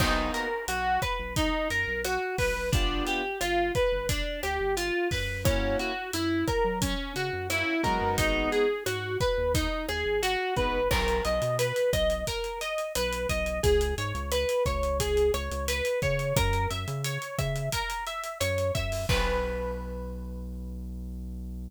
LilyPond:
<<
  \new Staff \with { instrumentName = "Acoustic Guitar (steel)" } { \time 4/4 \key b \major \tempo 4 = 88 dis'8 ais'8 fis'8 b'8 dis'8 ais'8 fis'8 b'8 | d'8 g'8 f'8 b'8 d'8 g'8 f'8 b'8 | cis'8 fis'8 e'8 ais'8 cis'8 fis'8 e'8 ais'8 | dis'8 gis'8 fis'8 b'8 dis'8 gis'8 fis'8 b'8 |
ais'8 dis''8 b'8 dis''8 ais'8 dis''8 b'8 dis''8 | gis'8 cis''8 b'8 cis''8 gis'8 cis''8 b'8 cis''8 | ais'8 e''8 cis''8 e''8 ais'8 e''8 cis''8 e''8 | b'1 | }
  \new Staff \with { instrumentName = "Acoustic Grand Piano" } { \time 4/4 \key b \major <ais b dis' fis'>1 | <b d' f' g'>1 | <ais cis' e' fis'>2. <ais cis' e' fis'>8 <gis b dis' fis'>8~ | <gis b dis' fis'>2.~ <gis b dis' fis'>8 <gis b dis' fis'>8 |
r1 | r1 | r1 | r1 | }
  \new Staff \with { instrumentName = "Synth Bass 1" } { \clef bass \time 4/4 \key b \major b,,4 b,,8. b,,8. fis,16 b,,8. b,,16 b,,16 | g,,4 g,,8. g,,8. d,16 g,,8. fis,8~ | fis,4 fis,8. fis8. cis16 fis,8. fis16 fis,16 | gis,,4 gis,8. dis,8. dis,16 gis,,8. gis,,16 gis,,16 |
b,,8 b,,16 b,8. b,,4. b,,8 b,,8 | cis,8 gis,16 cis,8. cis,4 cis,16 cis,8. cis8 | fis,8 fis,16 cis8. cis4. fis,8 fis,8 | b,,1 | }
  \new DrumStaff \with { instrumentName = "Drums" } \drummode { \time 4/4 <cymc bd ss>8 hh8 hh8 <hh bd ss>8 <hh bd>8 hh8 <hh ss>8 <hho bd>8 | <hh bd>8 hh8 <hh ss>8 <hh bd>8 <hh bd>8 <hh ss>8 hh8 <hho bd>8 | <hh bd ss>8 hh8 hh8 <hh bd ss>8 <hh bd>8 hh8 <hh ss>8 <hh bd>8 | <hh bd>8 hh8 <hh ss>8 <hh bd>8 <hh bd>8 <hh ss>8 hh8 <hh bd>8 |
<cymc bd ss>16 hh16 hh16 hh16 hh16 hh16 <hh bd ss>16 hh16 <hh bd>16 hh16 hh16 hh16 <hh ss>16 hh16 <hh bd>16 hh16 | <hh bd>16 hh16 hh16 hh16 <hh ss>16 hh16 <hh bd>16 hh16 <hh bd>16 hh16 <hh ss>16 hh16 hh16 hh16 <hh bd>16 hh16 | <hh bd ss>16 hh16 hh16 hh16 hh16 hh16 <hh bd ss>16 hh16 <hh bd>16 hh16 hh16 hh16 <hh ss>16 hh16 <hh bd>16 hho16 | <cymc bd>4 r4 r4 r4 | }
>>